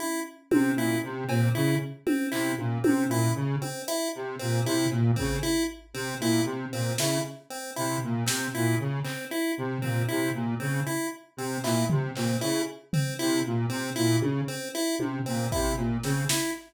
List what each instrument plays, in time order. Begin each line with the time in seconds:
0.00 lead 1 (square) E4, high tom
0.51 lead 1 (square) C3 C4, high tom
0.75 lead 1 (square) A#2 E4
1.03 lead 1 (square) C3
1.28 lead 1 (square) A#2 C4, cowbell
1.55 lead 1 (square) C#3 E4
2.06 lead 1 (square) C4, high tom
2.32 lead 1 (square) C3 E4, clap
2.58 lead 1 (square) A#2, high tom
2.84 lead 1 (square) C3 C4, high tom
3.08 lead 1 (square) A#2 E4
3.35 lead 1 (square) C#3
3.62 lead 1 (square) C4, high tom
3.88 lead 1 (square) E4, closed hi-hat
4.15 lead 1 (square) C3
4.39 lead 1 (square) A#2 C4
4.65 lead 1 (square) C3 E4
4.91 lead 1 (square) A#2, cowbell
5.16 lead 1 (square) C#3 C4, kick
5.43 lead 1 (square) E4
5.94 lead 1 (square) C3 C4
6.20 lead 1 (square) A#2 E4
6.45 lead 1 (square) C3
6.72 lead 1 (square) A#2 C4
6.98 lead 1 (square) C#3 E4, snare
7.50 lead 1 (square) C4
7.76 lead 1 (square) C3 E4
8.04 lead 1 (square) A#2
8.26 lead 1 (square) C3 C4, snare
8.55 lead 1 (square) A#2 E4
8.79 lead 1 (square) C#3
9.04 lead 1 (square) C4, clap
9.31 lead 1 (square) E4
9.58 lead 1 (square) C3
9.82 lead 1 (square) A#2 C4, floor tom
10.09 lead 1 (square) C3 E4
10.34 lead 1 (square) A#2
10.60 lead 1 (square) C#3 C4
10.87 lead 1 (square) E4
11.37 lead 1 (square) C3 C4
11.64 lead 1 (square) A#2 E4, clap
11.90 lead 1 (square) C3, floor tom
12.16 lead 1 (square) A#2 C4, clap
12.41 lead 1 (square) C#3 E4
12.93 lead 1 (square) C4, floor tom
13.19 lead 1 (square) C3 E4
13.46 lead 1 (square) A#2
13.69 lead 1 (square) C3 C4
13.96 lead 1 (square) A#2 E4
14.20 lead 1 (square) C#3, high tom
14.48 lead 1 (square) C4
14.75 lead 1 (square) E4
14.99 lead 1 (square) C3, high tom
15.26 lead 1 (square) A#2 C4
15.52 lead 1 (square) C3 E4, kick
15.77 lead 1 (square) A#2, cowbell
16.03 lead 1 (square) C#3 C4, snare
16.29 lead 1 (square) E4, snare